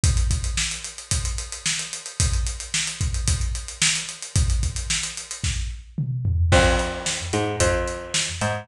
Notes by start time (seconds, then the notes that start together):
0.04 kick, closed hi-hat
0.17 closed hi-hat
0.31 kick, closed hi-hat
0.44 closed hi-hat
0.57 snare
0.71 closed hi-hat
0.84 closed hi-hat
0.98 closed hi-hat
1.11 kick, closed hi-hat
1.25 closed hi-hat
1.38 closed hi-hat
1.52 closed hi-hat
1.66 snare
1.79 closed hi-hat
1.93 closed hi-hat
2.06 closed hi-hat
2.20 kick, closed hi-hat
2.33 closed hi-hat
2.47 closed hi-hat
2.60 closed hi-hat
2.74 snare
2.87 closed hi-hat
3.01 kick, closed hi-hat
3.14 closed hi-hat
3.28 kick, closed hi-hat
3.41 closed hi-hat
3.55 closed hi-hat
3.68 closed hi-hat
3.82 snare
3.95 closed hi-hat
4.09 closed hi-hat
4.22 closed hi-hat
4.36 kick, closed hi-hat
4.50 closed hi-hat
4.63 kick, closed hi-hat
4.76 closed hi-hat
4.90 snare
5.03 closed hi-hat
5.17 closed hi-hat
5.31 closed hi-hat
5.44 kick, snare
5.98 mid tom
6.25 floor tom
6.52 F2, kick, crash
6.79 closed hi-hat
7.06 snare
7.33 G#2, closed hi-hat
7.60 F2, kick, closed hi-hat
7.88 closed hi-hat
8.14 snare
8.41 G#2, closed hi-hat